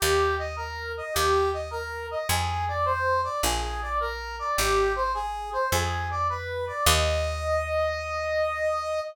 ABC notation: X:1
M:4/4
L:1/8
Q:"Swing" 1/4=105
K:Eb
V:1 name="Brass Section"
G e B e G e B e | A d c d A d B d | G c A c A d _c d | e8 |]
V:2 name="Electric Bass (finger)" clef=bass
E,,4 E,,4 | F,,4 B,,,4 | A,,,4 F,,4 | E,,8 |]